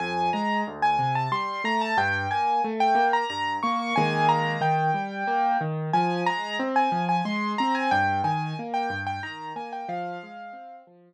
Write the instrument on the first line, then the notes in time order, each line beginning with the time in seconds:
acoustic grand piano
0.00 F2 G#5
0.33 G#3 A#5
0.67 D2
0.82 G#5
0.99 C3
1.15 A5
1.32 G3 C6
1.64 A3 A#5
1.81 A5
1.97 G2 G5
2.31 A#3 G#5
2.64 A3
2.80 G5
2.95 A#3
3.13 A#5
3.30 G2 A#5
3.63 A#3 C#6
3.79 C#6
3.96 D#3 G#3 A#3 G#5
4.29 A#5
4.61 D#3 G5
4.94 G3
5.27 A#3
5.61 D#3
5.93 F3 G#5
6.26 G#3 A#5
6.59 C4
6.76 G#5
6.92 F3
7.09 G#5
7.25 G#3 C6
7.58 C4 A#5
7.75 G#5
7.91 G2 G5
8.24 D#3 G#5
8.59 A#3
8.74 G5
8.90 G2
9.07 G5
9.23 D#3 A#5
9.56 A#3 G#5
9.73 G5
9.88 F3 F5
10.23 G#3
10.53 C4
10.87 F3